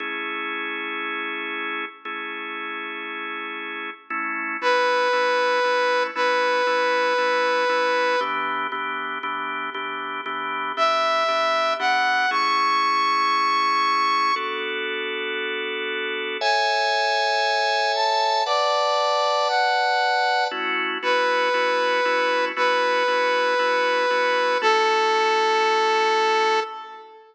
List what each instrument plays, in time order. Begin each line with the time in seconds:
0.00 drawbar organ A3 C#4 E4 G#4
2.05 drawbar organ A3 C#4 E4 G#4
4.10 drawbar organ A3 C#4 E4
4.62 drawbar organ A3 C#4 E4, lead 2 (sawtooth) B4
5.13 drawbar organ A3 C#4 E4
5.64 drawbar organ A3 C#4 E4
6.15 drawbar organ A3 C#4 E4, lead 2 (sawtooth) B4
6.67 drawbar organ A3 C#4 E4
7.18 drawbar organ A3 C#4 E4
7.69 drawbar organ A3 C#4 E4
8.21 drawbar organ E3 B3 D4 G4
8.72 drawbar organ E3 B3 D4 G4
9.23 drawbar organ E3 B3 D4 G4
9.74 drawbar organ E3 B3 D4 G4
10.26 drawbar organ E3 B3 D4 G4
10.77 drawbar organ E3 B3 D4 G4, lead 2 (sawtooth) E5
11.28 drawbar organ E3 B3 D4 G4
11.79 drawbar organ E3 B3 D4 G4, lead 2 (sawtooth) F#5
12.31 drawbar organ A3 C#4 E4 G#4, lead 2 (sawtooth) C#6
14.36 drawbar organ B3 D4 F#4 A4
16.41 drawbar organ A4 C#5 E5 G#5, lead 2 (sawtooth) G#5
17.95 lead 2 (sawtooth) A5
18.46 drawbar organ B4 D5 F#5 A5, lead 2 (sawtooth) D5
19.49 lead 2 (sawtooth) F#5
20.51 drawbar organ A3 C#4 E4 F#4
21.02 drawbar organ A3 C#4 E4 F#4, lead 2 (sawtooth) B4
21.54 drawbar organ A3 C#4 E4 F#4
22.05 drawbar organ A3 C#4 E4 F#4
22.56 drawbar organ A3 C#4 E4 F#4, lead 2 (sawtooth) B4
23.08 drawbar organ A3 C#4 E4 F#4
23.59 drawbar organ A3 C#4 E4 F#4
24.10 drawbar organ A3 C#4 E4 F#4
24.62 drawbar organ A3 C#4 E4 F#4, lead 2 (sawtooth) A4